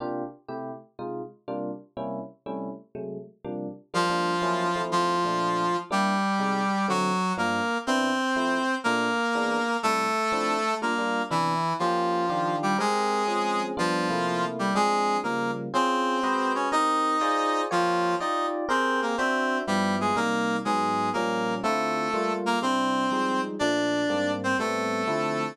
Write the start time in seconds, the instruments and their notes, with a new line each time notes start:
0.00 electric piano 1 C3 A#3 D4 F4 G4
0.48 electric piano 1 C3 A3 E4 G4
0.99 electric piano 1 C3 G#3 D#4 F4
1.48 electric piano 1 C3 G3 A#3 D4 F4
1.97 electric piano 1 C3 G3 A#3 C#4 E4
2.46 electric piano 1 C3 G3 A3 C#4 E4
2.95 electric piano 1 C3 F#3 G#3 A3
3.44 electric piano 1 C3 F3 G3 A#3 D4
3.94 brass section F3 F4, electric piano 1 G3 A#3 D4 F4
4.10 electric piano 1 G3 A#3 D4 F4
4.42 electric piano 1 F#3 A#3 C#4 E4
4.76 electric piano 1 F3 A3 C4 E4
4.92 brass section F3 F4
5.25 electric piano 1 A#2 A3 D4 F4
5.91 electric piano 1 G3 A#3 D4 E4, brass section G3 G4
6.39 electric piano 1 C3 G3 G#3 D#4
6.88 electric piano 1 D3 F#3 A3 C4, brass section F#3 F#4
7.37 electric piano 1 G2 F3 A#3 D4, brass section A#3 A#4
7.87 electric piano 1 C3 B3 D4 E4, brass section C4 C5
8.36 electric piano 1 F3 A3 C4 E4
8.84 electric piano 1 A#2 A3 D4 F4, brass section A#3 A#4
9.35 electric piano 1 E3 G#3 B3 D4
9.83 electric piano 1 C3 G3 A3 E4, brass section A3 A4
10.32 electric piano 1 F3 C4 D4 E4
10.82 electric piano 1 G3 A#3 D4 F4, brass section A#3 A#4
10.98 electric piano 1 G3 A#3 D4 F4
11.30 electric piano 1 C3 B3 D4 E4, brass section E3 E4
11.79 brass section F3 F4, electric piano 1 A#3 C#4 F4 G4
12.30 electric piano 1 D#3 D4 F4 G4
12.63 brass section G3 G4
12.78 electric piano 1 G#3 C4 G4 A#4, brass section G#3 G#4
13.28 electric piano 1 F3 C4 C#4 G#4
13.77 brass section F3 F4, electric piano 1 G3 B3 D4 F4
14.10 electric piano 1 C3 A3 A#3 E4
14.59 brass section G3 G4
14.75 electric piano 1 F3 G#3 C4 D4, brass section G#3 G#4
15.23 electric piano 1 C#3 F3 G3 A#3, brass section A#3 A#4
15.74 brass section C4 C5, electric piano 1 C#4 F4 G#4 C5
16.23 electric piano 1 G#3 F#4 B4 D#5
16.55 brass section C#4 C#5
16.72 electric piano 1 C4 G4 A#4 D#5, brass section D#4 D#5
17.21 electric piano 1 F4 G#4 C5 D5
17.71 brass section F3 F4, electric piano 1 A#3 F4 G4 C#5
18.20 brass section D#4 D#5, electric piano 1 D#4 F4 G4 D5
18.69 electric piano 1 C4 G4 G#4 A#4, brass section C4 C5
19.02 brass section A#3 A#4
19.17 brass section C4 C5, electric piano 1 D4 F#4 C5 E5
19.67 electric piano 1 G2 F3 B3 E4, brass section G3 G4
20.01 brass section G#3 G#4
20.16 electric piano 1 C3 G3 A#3 D#4, brass section A#3 A#4
20.65 electric piano 1 G#2 F#3 B3 D#4, brass section G#3 G#4
21.13 electric piano 1 A#2 F3 G3 C#4, brass section A#3 A#4
21.63 electric piano 1 D3 C4 E4 F4, brass section A3 A4
22.14 electric piano 1 G3 A3 A#3 F4
22.46 brass section A#3 A#4
22.62 electric piano 1 C3 G3 D4 E4, brass section C4 C5
23.11 electric piano 1 F3 G3 G#3 D#4
23.59 electric piano 1 A#2 F3 A3 D4, brass section D4 D5
24.10 electric piano 1 G#2 G3 A#3 C4
24.44 brass section C4 C5
24.59 electric piano 1 A2 G3 B3 C4, brass section A3 A4
25.08 electric piano 1 D3 F3 C4 E4